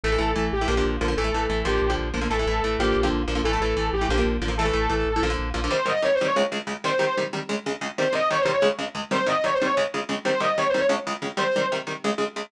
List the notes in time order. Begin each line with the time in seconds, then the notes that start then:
0.04 A1 E3 A3 A4
0.12 E3 A3
0.18 A1 E3 A3
0.36 A1 E3 A3
0.52 A1 G4
0.61 E3 A3
0.68 A#1 D3 F3 A#3
0.77 D3 F3 A#3
0.85 A#1
1.01 A#1 D3 F3 A#3
1.08 D3 F3 A#3
1.17 A1 E3 A3 A4
1.24 E3 A3
1.33 A1 E3 A3
1.50 A1 E3 A3
1.65 A1 D3 F3 A#3 G4
1.82 A#1
1.90 D3 F3 A#3
1.98 A#1
2.14 A#1 D3 F3 A#3
2.21 D3 F3 A#3
2.30 A1 E3 A3 A4
2.39 E3 A3
2.47 A1 E3 A3
2.63 A1 E3 A3
2.79 A1 D3 F3 A#3 G4
2.96 A#1
3.03 D3 F3 A#3
3.12 A#1
3.28 A#1 D3 F3 A#3
3.35 D3 F3 A#3
3.44 A1 E3 A3 A4
3.53 E3 A3
3.60 A1 E3 A3
3.77 A1 E3 A3
3.93 A1 G4
4.01 E3 A3
4.09 A#1 D3 F3 A#3
4.18 D3 F3 A#3
4.25 A#1
4.41 A1 D3 F3 A#3
4.48 D3 F3 A#3
4.57 E3 A3 A4
4.65 E3 A3
4.73 A1 E3 A3
4.90 A1 E3 A3
5.06 A1
5.16 E3 A3
5.22 A#1 D3 F3 A#3
5.30 D3 F3 A#3
5.38 A#1
5.54 A#1 D3 F3 A#3
5.64 D3 F3 A#3
5.71 C3 D#3 G3 C5
5.86 C3 D#3 G3 D#5
6.02 C3 D#3 G3 C#5
6.15 C5
6.21 C3 D#3 G3
6.25 C#5
6.36 C#2 C#3 G#3
6.52 C#2 C#3 G#3
6.67 C#2 C#3 G#3
6.84 C3 D#3 G3 C5
6.99 C3 D#3 G3
7.17 C3 D#3 G3
7.33 C3 D#3 G3
7.49 C#2 C#3 G#3
7.66 C#2 C#3 G#3
7.81 C#2 C#3 G#3
7.98 C3 D#3 G3 C5
8.13 C3 D#3 G3 D#5
8.30 C3 D#3 G3 C#5
8.41 C5
8.45 C3 D#3 G3
8.52 C#5
8.62 C#2 C#3 G#3
8.79 C#2 C#3 G#3
8.95 C#2 C#3 G#3
9.11 C3 D#3 G3 C5
9.26 C3 D#3 G3 D#5
9.44 C3 D#3 G3 C#5
9.54 C5
9.61 C3 D#3 G3 C#5
9.77 C#2 C#3 G#3
9.94 C#2 C#3 G#3
10.09 C#2 C#3 G#3
10.25 C3 D#3 G3 C5
10.40 C3 D#3 G3 D#5
10.57 C3 D#3 G3 C#5
10.69 C5
10.74 C3 D#3 G3
10.79 C#5
10.89 C#2 C#3 G#3
11.07 C#2 C#3 G#3
11.22 C#2 C#3 G#3
11.37 C3 D#3 G3 C5
11.56 C3 D#3 G3
11.72 C3 D#3 G3
11.87 C3 D#3 G3
12.04 C#2 C#3 G#3
12.18 C#2 C#3 G#3
12.36 C#2 C#3 G#3